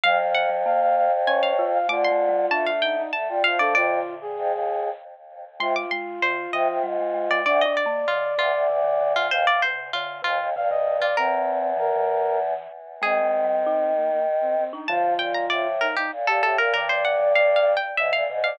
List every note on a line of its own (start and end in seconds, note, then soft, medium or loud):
0.03 1.78 F2 medium
0.03 0.19 F#3 loud
0.03 0.31 F5 medium
0.03 0.18 F5 loud
0.19 0.46 F#3 medium
0.19 0.49 F5 medium
0.35 0.91 F#5 medium
0.49 0.64 F#3 medium
0.65 1.08 A#3 medium
0.65 0.80 F5 medium
0.81 0.96 F5 medium
0.96 1.11 F5 medium
1.27 1.53 C#4 medium
1.27 1.65 C#5 medium
1.27 1.42 G#5 medium
1.43 1.80 F5 medium
1.59 1.86 F4 medium
1.73 1.88 F5 medium
1.89 2.45 D3 medium
1.89 2.08 A3 loud
1.89 2.70 F4 medium
1.89 2.04 D6 medium
2.05 2.47 C6 medium
2.11 2.31 A3 medium
2.29 2.48 G3 loud
2.51 3.02 A3 medium
2.51 3.02 D4 loud
2.51 2.66 A5 medium
2.66 2.81 F5 medium
2.82 2.96 D#4 medium
2.82 3.07 G5 medium
2.97 3.11 D#4 medium
3.13 3.28 A3 medium
3.13 3.39 A5 medium
3.28 3.42 G3 medium
3.28 3.43 F4 medium
3.44 3.74 F3 medium
3.44 3.58 F4 medium
3.44 3.59 F5 medium
3.59 3.75 D4 loud
3.59 3.74 A4 medium
3.59 3.74 D5 medium
3.74 4.00 F2 medium
3.74 4.80 A#2 medium
3.74 4.80 D3 loud
3.74 4.14 F4 medium
3.74 4.25 D5 medium
4.21 4.89 G#4 medium
4.37 4.52 F2 medium
4.51 4.90 D#2 medium
5.60 5.75 C3 medium
5.60 5.85 G#3 loud
5.60 7.41 F4 medium
5.60 5.75 C6 medium
5.76 5.91 D6 medium
5.91 6.20 G#3 loud
5.91 6.18 C6 medium
6.22 6.47 D#3 medium
6.22 6.51 C5 medium
6.53 6.68 C3 medium
6.53 6.79 F3 medium
6.53 6.79 D#5 medium
6.68 6.83 C3 medium
6.83 7.39 G#2 medium
6.83 6.98 G3 loud
7.00 7.13 G#3 medium
7.14 7.29 G#3 loud
7.31 7.46 G#3 medium
7.31 7.45 D5 medium
7.45 7.62 D2 medium
7.45 7.65 D4 loud
7.45 9.13 D5 medium
7.45 7.60 D5 medium
7.61 7.76 D#5 medium
7.66 7.85 D4 medium
7.77 8.02 D5 medium
7.86 8.06 A#3 loud
8.08 8.36 D3 medium
8.08 8.34 F4 medium
8.38 8.52 D2 medium
8.38 8.65 C3 medium
8.38 8.67 F4 medium
8.54 8.68 D2 medium
8.69 9.27 D2 medium
8.69 8.84 C3 medium
8.84 8.99 D3 medium
9.01 9.30 D3 medium
9.16 9.31 F4 medium
9.30 9.45 D#2 medium
9.30 9.61 C3 medium
9.30 9.46 C5 medium
9.30 9.62 F5 medium
9.47 9.62 D5 medium
9.62 9.92 C3 medium
9.62 9.92 C5 medium
9.93 10.24 D3 loud
9.93 10.22 F4 medium
10.22 10.39 D#2 medium
10.22 10.47 C3 medium
10.22 10.50 F4 medium
10.39 10.54 D#2 medium
10.55 11.06 G2 medium
10.55 10.70 C3 medium
10.55 10.70 F5 medium
10.70 10.85 C3 loud
10.70 10.97 D#5 medium
10.87 11.00 C3 medium
11.00 11.15 C3 medium
11.00 11.16 F4 medium
11.00 11.16 D5 medium
11.16 12.54 E2 medium
11.16 11.72 C4 medium
11.16 11.98 A#4 medium
11.77 11.91 E3 medium
11.77 12.38 A#4 medium
11.96 12.67 E3 medium
13.02 14.64 D#3 medium
13.02 13.21 G#3 loud
13.02 13.92 C4 medium
13.02 14.70 G#4 medium
13.24 13.43 G#3 medium
13.44 13.64 G3 medium
13.66 14.19 D#4 loud
13.95 14.10 A#3 medium
14.11 14.26 A#3 medium
14.41 14.55 C4 medium
14.57 14.72 C4 medium
14.73 14.88 D4 medium
14.73 14.88 D#4 medium
14.88 16.09 D3 medium
14.88 15.13 F3 medium
14.88 16.09 F3 loud
14.88 15.67 F4 medium
14.88 15.18 A5 medium
15.19 15.45 A#2 medium
15.19 15.34 G5 medium
15.34 15.49 A#5 medium
15.50 15.87 A2 medium
15.50 15.80 D5 medium
15.81 15.95 D#4 medium
15.81 15.96 A#4 medium
15.96 16.11 D#4 medium
15.96 16.11 G4 medium
16.12 16.26 A#2 medium
16.27 16.42 A#2 medium
16.27 16.42 G4 medium
16.27 16.42 A4 medium
16.42 16.57 A2 medium
16.42 16.58 G4 medium
16.42 16.58 A4 medium
16.58 16.73 A#2 medium
16.58 16.73 A#4 medium
16.74 17.75 G2 medium
16.74 16.89 D3 loud
16.74 16.88 A#4 medium
16.74 17.73 D5 medium
16.89 17.16 D3 medium
16.89 17.04 C5 medium
17.05 17.32 F#5 medium
17.19 17.34 D3 medium
17.35 17.79 D3 medium
17.35 17.55 F5 medium
17.56 17.76 F5 medium
17.77 17.96 G5 medium
17.97 18.11 G#2 medium
17.97 18.23 D3 medium
17.97 18.12 E5 medium
17.97 18.24 E5 medium
18.12 18.27 A#2 medium
18.12 18.39 F5 medium
18.29 18.56 G#2 medium
18.29 18.57 C3 medium
18.44 18.58 D5 medium
18.44 18.58 F5 medium